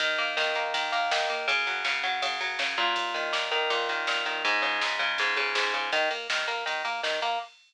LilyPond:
<<
  \new Staff \with { instrumentName = "Overdriven Guitar" } { \time 4/4 \key dis \phrygian \tempo 4 = 162 dis8 ais8 dis8 ais8 dis8 ais8 dis8 ais8 | cis8 fis8 cis8 fis8 cis8 fis8 cis8 ais,8~ | ais,8 dis8 ais,8 dis8 ais,8 dis8 ais,8 dis8 | gis,8 cis8 gis,8 cis8 gis,8 cis8 gis,8 cis8 |
dis8 ais8 dis8 ais8 dis8 ais8 dis8 ais8 | }
  \new Staff \with { instrumentName = "Synth Bass 1" } { \clef bass \time 4/4 \key dis \phrygian dis,8 dis,8 dis,8 dis,8 dis,8 dis,8 dis,8 dis,8 | fis,8 fis,8 fis,8 fis,8 fis,8 fis,8 fis,8 fis,8 | dis,8 dis,8 dis,8 dis,8 dis,8 dis,8 dis,8 dis,8 | cis,8 cis,8 cis,8 cis,8 cis,8 cis,8 cis,8 cis,8 |
dis,8 dis,8 dis,8 dis,8 dis,8 dis,8 dis,8 dis,8 | }
  \new DrumStaff \with { instrumentName = "Drums" } \drummode { \time 4/4 <bd cymr>8 cymr8 sn8 cymr8 <bd cymr>8 cymr8 sn8 cymr8 | <bd cymr>8 cymr8 sn8 cymr8 <bd cymr>8 cymr8 sn8 <bd cymr>8 | <bd cymr>8 cymr8 sn8 cymr8 <bd cymr>8 <bd cymr>8 sn8 cymr8 | <bd cymr>8 cymr8 sn8 <bd cymr>8 <bd cymr>8 cymr8 sn8 cymr8 |
<bd cymr>8 cymr8 sn8 cymr8 <bd cymr>8 cymr8 sn8 cymr8 | }
>>